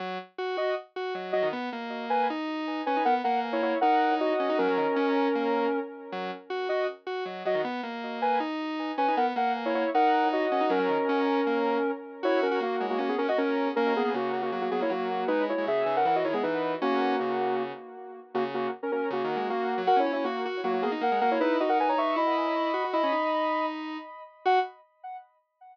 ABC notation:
X:1
M:4/4
L:1/16
Q:1/4=157
K:F#mix
V:1 name="Lead 1 (square)"
z6 [Fd]2 z6 [Fd]2 | z6 [Bg]2 z6 [Bg]2 | [Af] z [Af]2 z [Ec] [Ec]2 [Af]4 [Fd]4 | [CA]14 z2 |
z6 [Fd]2 z6 [Fd]2 | z6 [Bg]2 z6 [Bg]2 | [Af] z [Af]2 z [Ec] [Ec]2 [Af]4 [Fd]4 | [CA]14 z2 |
[Ec]2 [CA]2 [A,F]3 [A,F] [A,F] [B,G] [CA] [Fd] [CA]4 | [CA]2 [B,G]2 [A,F]3 [A,F] [A,F] [A,F] [B,G] [Ec] [A,F]4 | [DB]2 [Ec]2 [Ge]3 [Af] [Af] [Fd] [Ec] [B,G] [DB]4 | [A,F]10 z6 |
[A,F] z [A,F]2 z [CA] [CA]2 [A,F]4 [A,F]4 | (3[Af]2 [Ec]2 [Ec]2 [A,F]3 z [A,F] [A,F] [B,G] z [Af]2 [Af] [Ec] | [DB]2 [Fd] [Af] [Bg] [ca] [ec']2 [db]8 | [db]8 z8 |
f4 z12 |]
V:2 name="Lead 1 (square)"
F,2 z2 F2 F2 z2 F2 F,2 F, D, | B,2 A,6 D6 C D | B,2 A,6 D6 C D | F, F, D, z C4 A,4 z4 |
F,2 z2 F2 F2 z2 F2 F,2 F, D, | B,2 A,6 D6 C D | B,2 A,6 D6 C D | F, F, D, z C4 A,4 z4 |
F3 F A,2 G,2 C2 C F C4 | A,3 A, C,2 C,2 F,2 F, A, F,4 | G,3 G, C,2 C,2 E,2 D, G, E,4 | C4 C,6 z6 |
C,4 z4 (3C,2 D,2 G,2 A,3 F, | F C C C F2 F2 F,2 A, D A, G, A,2 | E2 D6 E6 F F | E C D10 z4 |
F4 z12 |]